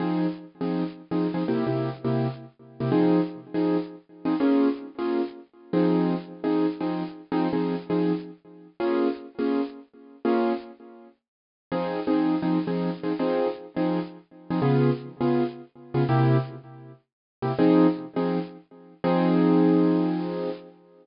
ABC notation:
X:1
M:4/4
L:1/8
Q:"Swing" 1/4=164
K:Fm
V:1 name="Acoustic Grand Piano"
[F,CEA]3 [F,CEA]3 [F,CEA] [F,CEA] | [C,B,=EG] [C,B,EG]2 [C,B,EG]4 [C,B,EG] | [F,CEA]3 [F,CEA]4 [F,CEA] | [B,DFA]3 [B,DFA]4 [F,CEA]- |
[F,CEA]3 [F,CEA]2 [F,CEA]3 | [F,CEA] [F,CEA]2 [F,CEA]5 | [B,DFA]3 [B,DFA]5 | [B,DFA]8 |
[F,CEA]2 [F,CEA]2 [F,CEA] [F,CEA]2 [F,CEA] | [F,CEA]3 [F,CEA]4 [F,CEA] | [D,_CFA]3 [D,CFA]4 [D,CFA] | [C,B,=EG]7 [C,B,EG] |
[F,CEA]3 [F,CEA]5 | [F,CEA]8 |]